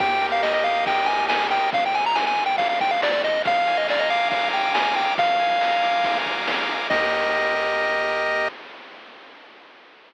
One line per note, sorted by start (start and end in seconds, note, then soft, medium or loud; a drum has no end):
0.00 1.59 D#2 loud
0.00 0.64 G4 medium
0.00 0.27 G5 loud
0.00 kick loud
0.00 ride loud
0.22 0.87 A#4 medium
0.22 ride medium
0.32 0.42 F5 loud
0.43 0.53 D#5 loud
0.43 1.08 D#5 medium
0.43 snare loud
0.54 0.64 D#5 medium
0.64 1.29 G4 medium
0.64 0.85 F5 loud
0.64 ride medium
0.86 1.50 A#4 medium
0.86 1.08 G5 loud
0.86 kick loud
0.86 ride loud
1.06 1.70 D#5 medium
1.06 1.26 G#5 loud
1.06 ride medium
1.29 1.70 G4 medium
1.29 1.47 G#5 medium
1.29 snare loud
1.50 1.71 A#4 medium
1.50 1.70 G5 loud
1.50 snare medium
1.50 ride medium
1.73 2.96 G#1 loud
1.73 1.84 F5 loud
1.73 kick loud
1.73 ride loud
1.86 1.96 G5 loud
1.94 2.05 G#5 loud
1.94 ride medium
2.06 2.16 A#5 loud
2.15 2.25 G#5 loud
2.15 snare loud
2.27 2.44 G#5 loud
2.37 ride medium
2.46 2.56 G5 loud
2.58 2.68 F5 loud
2.58 kick medium
2.58 ride loud
2.69 2.79 F5 medium
2.80 2.91 G5 loud
2.80 kick medium
2.80 ride medium
2.91 3.01 F5 loud
3.02 3.22 G#1 loud
3.02 3.12 D5 loud
3.02 snare loud
3.12 3.22 D5 loud
3.24 3.43 A1 loud
3.24 3.42 D#5 loud
3.24 snare medium
3.24 ride medium
3.45 5.04 A#1 loud
3.45 4.30 F5 loud
3.45 3.77 F5 loud
3.45 kick loud
3.45 ride loud
3.67 4.52 G#5 medium
3.67 ride medium
3.77 3.87 D#5 loud
3.88 4.01 D5 loud
3.88 4.74 A#5 medium
3.88 snare loud
3.99 4.10 D#5 loud
4.10 4.29 F5 loud
4.10 4.96 D6 medium
4.10 ride medium
4.30 4.49 F5 loud
4.30 5.13 F5 medium
4.30 kick loud
4.30 ride loud
4.53 4.73 G5 medium
4.53 5.14 G#5 medium
4.53 ride medium
4.74 4.95 G#5 medium
4.74 5.15 A#5 medium
4.74 snare loud
4.96 5.14 G5 medium
4.96 5.17 D6 medium
4.96 snare medium
4.96 ride medium
5.18 6.77 A#1 loud
5.18 6.05 F5 loud
5.18 6.18 F5 loud
5.18 kick loud
5.18 ride loud
5.39 6.26 G#5 medium
5.39 ride medium
5.61 6.46 A#5 medium
5.61 snare loud
5.83 6.68 D6 medium
5.83 ride medium
6.04 6.87 F5 medium
6.04 kick loud
6.04 ride loud
6.26 6.88 G#5 medium
6.26 kick medium
6.26 ride medium
6.47 6.88 A#5 medium
6.47 snare loud
6.69 6.89 D6 medium
6.69 snare medium
6.69 ride medium
6.90 8.49 D#2 loud
6.90 8.49 G4 medium
6.90 8.49 A#4 medium
6.90 8.48 D#5 loud
6.90 8.49 D#5 loud
6.90 kick loud
6.90 crash loud